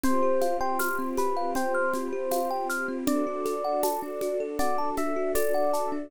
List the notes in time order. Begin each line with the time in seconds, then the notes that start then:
0.03 C4 F4 G4 C5, low conga, shaker
0.23 G4
0.41 F5, high conga, shaker
0.61 C5 G5
0.79 F6, tambourine, high conga, shaker
0.99 C4
1.17 G4 B4, high conga, shaker
1.37 F5
1.55 C5 G5, low conga, shaker
1.75 F6
1.94 C4, high conga, shaker
2.13 G4
2.31 F5, tambourine, high conga, shaker
2.50 G5
2.69 F6, shaker
2.88 C4
3.07 D4 F#4 A4 D5, low conga, shaker
3.27 F#4
3.45 A4, high conga, shaker
3.64 F#5
3.83 A5, tambourine, high conga, shaker
4.02 D4
4.21 F#4, high conga, shaker
4.40 A4
4.59 D5 F#5, low conga, shaker
4.78 A5
4.97 D4 E5, high conga, shaker
5.16 F#4
5.35 A4 D5, tambourine, high conga, shaker
5.54 F#5
5.73 A5, shaker
5.92 D4